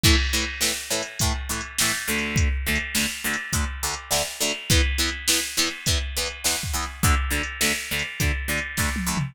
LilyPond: <<
  \new Staff \with { instrumentName = "Acoustic Guitar (steel)" } { \time 4/4 \key a \major \tempo 4 = 103 <a, e a>8 <a, e a>8 <a, e a>8 <a, e a>8 <a, e a>8 <a, e a>8 <a, e a>8 <d, d a>8~ | <d, d a>8 <d, d a>8 <d, d a>8 <d, d a>8 <d, d a>8 <d, d a>8 <d, d a>8 <d, d a>8 | <e, e b>8 <e, e b>8 <e, e b>8 <e, e b>8 <e, e b>8 <e, e b>8 <e, e b>8 <e, e b>8 | <d, d a>8 <d, d a>8 <d, d a>8 <d, d a>8 <d, d a>8 <d, d a>8 <d, d a>8 <d, d a>8 | }
  \new DrumStaff \with { instrumentName = "Drums" } \drummode { \time 4/4 \tuplet 3/2 { <cymc bd>8 r8 hh8 sn8 r8 hh8 <hh bd>8 r8 hh8 sn8 r8 hh8 } | \tuplet 3/2 { <hh bd>8 r8 hh8 sn8 r8 hh8 <hh bd>8 r8 hh8 sn8 r8 hh8 } | \tuplet 3/2 { <hh bd>8 r8 hh8 sn8 r8 hh8 <hh bd>8 r8 hh8 sn8 bd8 hh8 } | \tuplet 3/2 { <hh bd>8 r8 hh8 sn8 r8 hh8 <hh bd>8 r8 hh8 <bd sn>8 tommh8 toml8 } | }
>>